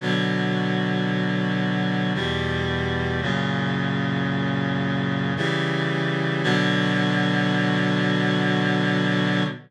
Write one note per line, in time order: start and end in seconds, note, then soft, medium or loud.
0.01 2.13 B2 medium
0.01 2.13 D3 medium
0.01 2.13 F#3 medium
2.15 3.21 E2 medium
2.15 3.21 B2 medium
2.15 3.21 G3 medium
3.22 5.34 F#2 medium
3.22 5.34 A#2 medium
3.22 5.34 C#3 medium
5.37 6.43 C#3 medium
5.37 6.43 E3 medium
5.37 6.43 G3 medium
6.43 9.43 B2 loud
6.43 9.43 D3 loud
6.43 9.43 F#3 loud